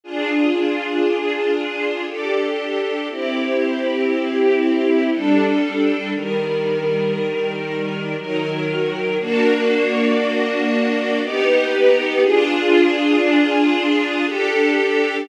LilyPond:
\new Staff { \time 3/4 \key f \minor \tempo 4 = 59 <d' f' aes'>2 <d' g' a'>4 | <c' e' g'>2 <g d' a'>4 | <ees g bes'>2 <ees ges bes'>4 | <bes d' fis'>2 <b dis' g'>4 |
<d' f' aes'>2 <d' g' a'>4 | }